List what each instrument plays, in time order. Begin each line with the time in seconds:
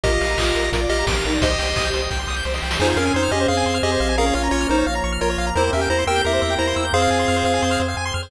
0.04 synth bass 1 A#1, violin F4, lead 1 (square) G4 A#4 D#5, drawbar organ A#4 D#5 F5, kick, closed hi-hat
0.12 lead 1 (square) D#5
0.21 synth bass 1 A#1, lead 1 (square) F5, open hi-hat
0.30 lead 1 (square) A#5
0.37 synth bass 1 A#1, violin F4, drawbar organ A#4 F5 A#5, lead 1 (square) D#6, kick, clap
0.47 lead 1 (square) F6
0.55 synth bass 1 A#1, lead 1 (square) A#4, open hi-hat
0.64 lead 1 (square) D#5
0.72 synth bass 1 A#1, violin F4, drawbar organ A#4 D5 F5, lead 1 (square) A#4, kick, closed hi-hat
0.81 lead 1 (square) D5
0.89 synth bass 1 A#1, lead 1 (square) G4 D#5 F5, open hi-hat
0.98 violin G4, lead 1 (square) A#5
1.07 synth bass 1 A#1, drawbar organ A#4 F5 A#5, lead 1 (square) D6, kick, snare
1.16 lead 1 (square) F6
1.24 synth bass 1 A#1, violin D#4, lead 1 (square) A#4, open hi-hat
1.33 lead 1 (square) D5
1.41 synth bass 1 C2, lead 1 (square) G4 C5 D#5, violin G4, drawbar organ C5 D#5 G5, kick, closed hi-hat
1.50 lead 1 (square) D#5
1.59 synth bass 1 C2, lead 1 (square) G5, open hi-hat
1.67 lead 1 (square) C6
1.76 synth bass 1 C2, lead 1 (square) D#6, kick, clap
1.85 lead 1 (square) G6
1.93 synth bass 1 C2, lead 1 (square) C5, open hi-hat
2.02 lead 1 (square) D#5
2.11 synth bass 1 C2, drawbar organ G4 C5 G5, lead 1 (square) G5, kick, snare
2.19 lead 1 (square) C6
2.27 synth bass 1 C2, lead 1 (square) D#6, snare
2.36 lead 1 (square) G6
2.45 synth bass 1 C2, lead 1 (square) C5, snare
2.54 lead 1 (square) D#5, snare
2.62 synth bass 1 C2, lead 1 (square) G5, snare
2.71 lead 1 (square) C6, snare
2.79 synth bass 1 F2, drawbar organ C4 F4 G#4, lead 1 (square) D#4 G#4 C5, violin F4
2.88 lead 1 (square) C5
2.96 synth bass 1 F2, lead 1 (square) C#4 A#4 F5, violin C#4
3.05 lead 1 (square) G#5
3.14 synth bass 1 F2, lead 1 (square) D#4 C5 C6
3.23 lead 1 (square) F6
3.31 synth bass 1 F2, violin C#4, lead 1 (square) G4 G#4 D#5
3.40 lead 1 (square) C5
3.48 synth bass 1 F2, violin C4, drawbar organ C4 G#4 C5, lead 1 (square) G#4 F5
3.57 lead 1 (square) G#5
3.66 synth bass 1 F2, lead 1 (square) C6
3.74 lead 1 (square) F6
3.83 synth bass 1 F2, lead 1 (square) G4 G#4 D#5
3.92 lead 1 (square) C5
4.00 synth bass 1 A#1, lead 1 (square) F5
4.09 lead 1 (square) G#5
4.17 drawbar organ A#3 C#4 F4, violin C#4, lead 1 (square) G#4 A#4 F5
4.26 lead 1 (square) C#5
4.33 synth bass 1 A#1, violin C#4, lead 1 (square) F4 C#5 F5
4.43 lead 1 (square) A#5
4.51 synth bass 1 A#1, lead 1 (square) F4 C#5 C#6
4.61 lead 1 (square) F6
4.68 synth bass 1 A#1, violin D#4, lead 1 (square) D#4 A#4 C5
4.78 lead 1 (square) C#5
4.86 synth bass 1 A#1, drawbar organ F3 A#3 F4, violin C#5, lead 1 (square) F5
4.95 lead 1 (square) A#5
5.04 synth bass 1 A#1, lead 1 (square) C#6
5.12 lead 1 (square) F6
5.21 synth bass 1 A#1, lead 1 (square) F4 A#4 C#5
5.30 lead 1 (square) C#5
5.38 synth bass 1 A#1, lead 1 (square) F5
5.47 lead 1 (square) A#5
5.55 synth bass 1 E2, drawbar organ A#3 C4 E4 G4, lead 1 (square) E4 A#4 C5, violin A#4
5.64 lead 1 (square) C5
5.73 synth bass 1 E2, lead 1 (square) C#4 A#4 E5, violin G4
5.81 lead 1 (square) G5
5.90 synth bass 1 E2, lead 1 (square) E4 C5 A#5
5.99 lead 1 (square) C6
6.07 synth bass 1 E2, violin G4, lead 1 (square) A#4 G5 E6
6.16 lead 1 (square) G6
6.24 synth bass 1 E2, drawbar organ A#3 C4 G4 A#4, violin E4, lead 1 (square) G4 A#4 E5
6.33 lead 1 (square) C5
6.42 synth bass 1 E2, lead 1 (square) E5
6.50 lead 1 (square) G5
6.58 synth bass 1 E2, lead 1 (square) E4 C5 A#5
6.67 lead 1 (square) C6
6.76 synth bass 1 E2, lead 1 (square) E6
6.85 lead 1 (square) G6
6.93 synth bass 1 F2, violin C4, drawbar organ C4 F4 G#4, lead 1 (square) G#4 C5 F5
7.02 lead 1 (square) F5
7.11 synth bass 1 F2, lead 1 (square) G#5
7.19 lead 1 (square) C6
7.28 synth bass 1 F2, lead 1 (square) F6
7.36 lead 1 (square) C5
7.44 synth bass 1 F2, lead 1 (square) F5
7.54 lead 1 (square) G#5
7.62 synth bass 1 F2, drawbar organ C4 G#4 C5, lead 1 (square) C6
7.71 lead 1 (square) F6
7.80 synth bass 1 F2, lead 1 (square) C5
7.88 lead 1 (square) F5
7.97 synth bass 1 F2, lead 1 (square) G#5
8.05 lead 1 (square) C6
8.14 synth bass 1 F2, lead 1 (square) F6
8.23 lead 1 (square) C5